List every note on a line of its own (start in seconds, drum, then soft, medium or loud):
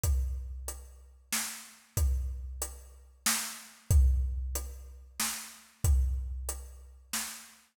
0.03 kick medium
0.03 closed hi-hat loud
0.68 closed hi-hat medium
1.32 snare loud
1.97 kick medium
1.97 closed hi-hat loud
2.62 closed hi-hat loud
3.26 snare loud
3.91 kick loud
3.91 closed hi-hat medium
4.55 closed hi-hat loud
5.20 snare loud
5.84 kick loud
5.84 closed hi-hat loud
6.49 closed hi-hat loud
7.13 snare medium